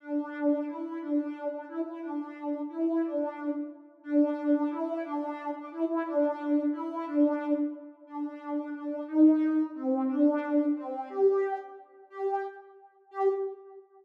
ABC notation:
X:1
M:6/8
L:1/8
Q:3/8=119
K:G
V:1 name="Ocarina"
D4 E2 | D3 D E E | D4 E2 | D3 z3 |
D4 E2 | D3 D E E | D4 E2 | D3 z3 |
[K:Gm] D4 D2 | E4 C2 | D4 C2 | G3 z3 |
[K:G] G2 z4 | G3 z3 |]